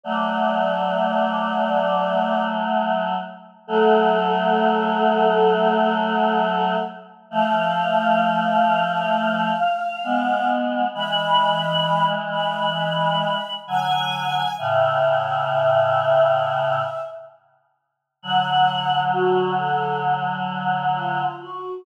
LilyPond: <<
  \new Staff \with { instrumentName = "Choir Aahs" } { \time 4/4 \key fis \minor \tempo 4 = 66 d''2. r4 | \key a \major a'1 | f''1 | b''4. b''4. gis''4 |
e''2. r4 | \key fis \minor fis''4 fis'8 a'8 r4 eis'8 fis'8 | }
  \new Staff \with { instrumentName = "Choir Aahs" } { \time 4/4 \key fis \minor <fis a>1 | \key a \major <fis a>1 | <f a>2. <gis b>4 | <e gis>2. <d fis>4 |
<a, cis>2. r4 | \key fis \minor <d fis>1 | }
>>